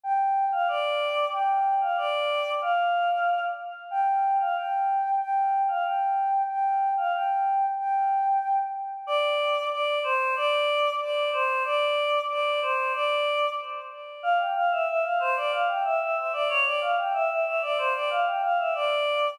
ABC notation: X:1
M:2/4
L:1/16
Q:1/4=93
K:Gm
V:1 name="Choir Aahs"
g3 f d4 | g3 f d4 | f6 z2 | g3 f g4 |
g3 f g4 | g3 f g4 | g6 z2 | [K:Dm] d4 d2 c2 |
d4 d2 c2 | d4 d2 c2 | d4 z4 | f g f e e f c d |
f g e e e d ^c d | f g e e e d c d | f g f e d4 |]